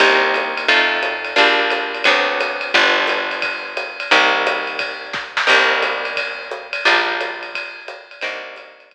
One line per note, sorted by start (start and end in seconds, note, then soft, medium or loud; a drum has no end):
0.00 0.66 C2 loud
0.00 0.67 A#3 medium
0.00 0.67 C4 medium
0.00 0.67 D#4 medium
0.00 0.67 G4 medium
0.00 kick medium
0.00 crash loud
0.00 ride loud
0.34 hi-hat pedal medium
0.34 ride medium
0.57 ride medium
0.68 1.34 F2 loud
0.68 1.36 A3 medium
0.68 1.36 C4 medium
0.68 1.36 D#4 medium
0.68 1.35 F4 medium
0.68 kick medium
0.68 ride loud
1.03 hi-hat pedal medium
1.03 ride medium
1.25 ride medium
1.36 2.03 A#1 loud
1.36 2.04 G3 medium
1.36 2.04 A#3 medium
1.36 2.04 D4 medium
1.36 2.04 F4 medium
1.36 kick medium
1.36 ride medium
1.70 hi-hat pedal medium
1.70 ride medium
1.95 ride medium
2.04 2.72 D2 medium
2.04 2.73 F#3 medium
2.04 2.73 B3 medium
2.04 2.73 C4 medium
2.04 2.73 D4 medium
2.04 kick medium
2.04 ride loud
2.40 hi-hat pedal medium
2.40 ride medium
2.61 ride medium
2.74 4.04 G1 loud
2.74 4.09 F3 medium
2.74 4.09 G3 medium
2.74 4.09 B3 medium
2.74 4.09 D4 medium
2.74 kick medium
2.74 ride loud
3.07 hi-hat pedal medium
3.07 ride medium
3.31 ride medium
3.42 kick medium
3.42 ride loud
3.77 hi-hat pedal medium
3.77 ride medium
4.00 ride medium
4.11 5.42 C2 loud
4.11 5.46 G3 medium
4.11 5.46 A#3 medium
4.11 5.46 C4 medium
4.11 5.46 D#4 medium
4.11 kick medium
4.11 ride loud
4.47 hi-hat pedal loud
4.47 ride medium
4.67 ride medium
4.79 kick medium
4.79 ride loud
5.13 kick medium
5.13 snare medium
5.37 snare loud
5.47 6.79 C2 loud
5.47 6.82 G3 medium
5.47 6.82 A#3 medium
5.47 6.82 C4 medium
5.47 6.82 D#4 medium
5.47 kick medium
5.47 crash loud
5.47 ride loud
5.82 hi-hat pedal medium
5.82 ride medium
6.05 ride medium
6.17 kick medium
6.17 ride loud
6.51 hi-hat pedal medium
6.73 ride medium
6.85 8.16 A#1 medium
6.85 8.21 F3 medium
6.85 8.21 G3 medium
6.85 8.21 A#3 medium
6.85 8.21 D4 medium
6.85 ride loud
7.21 hi-hat pedal medium
7.21 ride medium
7.43 ride medium
7.55 kick medium
7.55 ride loud
7.88 hi-hat pedal medium
7.88 ride medium
8.11 ride medium
8.21 8.94 C2 loud
8.21 8.94 G3 medium
8.21 8.94 A#3 medium
8.21 8.94 C4 medium
8.21 8.94 D#4 medium
8.21 kick medium
8.21 ride loud
8.56 hi-hat pedal medium
8.56 ride medium
8.80 ride medium
8.91 kick medium
8.91 ride medium